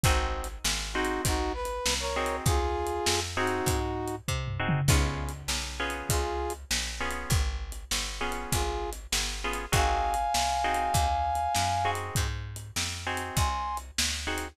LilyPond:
<<
  \new Staff \with { instrumentName = "Brass Section" } { \time 4/4 \key aes \major \tempo 4 = 99 r4. <ees' ges'>8 <ees' ges'>8 b'8. <bes' des''>8. | <f' aes'>4. <ees' ges'>4. r4 | r2 <f' aes'>8. r4 r16 | r2 <f' aes'>8. r4 r16 |
<f'' aes''>1 | r2 <aes'' c'''>8. r4 r16 | }
  \new Staff \with { instrumentName = "Acoustic Guitar (steel)" } { \time 4/4 \key aes \major <c' ees' ges' aes'>4. <c' ees' ges' aes'>2 <c' ees' ges' aes'>8~ | <c' ees' ges' aes'>4. <c' ees' ges' aes'>2 <c' ees' ges' aes'>8 | <ces' des' f' aes'>4. <ces' des' f' aes'>2 <ces' des' f' aes'>8~ | <ces' des' f' aes'>4. <ces' des' f' aes'>2 <ces' des' f' aes'>8 |
<c' ees' ges' aes'>4. <c' ees' ges' aes'>2 <c' ees' ges' aes'>8~ | <c' ees' ges' aes'>4. <c' ees' ges' aes'>2 <c' ees' ges' aes'>8 | }
  \new Staff \with { instrumentName = "Electric Bass (finger)" } { \clef bass \time 4/4 \key aes \major aes,,4 aes,,4 aes,,4 c,4 | ees,4 f,4 aes,4 c4 | des,4 ces,4 des,4 bes,,4 | aes,,4 g,,4 aes,,4 g,,4 |
aes,,4 c,4 ees,4 ges,4 | aes,4 f,4 c,4 d,4 | }
  \new DrumStaff \with { instrumentName = "Drums" } \drummode { \time 4/4 \tuplet 3/2 { <hh bd>8 r8 hh8 sn8 r8 hh8 <hh bd>8 r8 hh8 sn8 r8 hh8 } | \tuplet 3/2 { <hh bd>8 r8 hh8 sn8 r8 hh8 <hh bd>8 r8 hh8 bd8 tomfh8 toml8 } | \tuplet 3/2 { <cymc bd>8 r8 hh8 sn8 r8 hh8 <hh bd>8 r8 hh8 sn8 r8 hh8 } | \tuplet 3/2 { <hh bd>8 r8 hh8 sn8 r8 hh8 <hh bd>8 r8 hh8 sn8 r8 hh8 } |
\tuplet 3/2 { <hh bd>8 r8 hh8 sn8 r8 hh8 <hh bd>8 r8 hh8 sn8 r8 hh8 } | \tuplet 3/2 { <hh bd>8 r8 hh8 sn8 r8 hh8 <hh bd>8 r8 hh8 sn8 r8 hh8 } | }
>>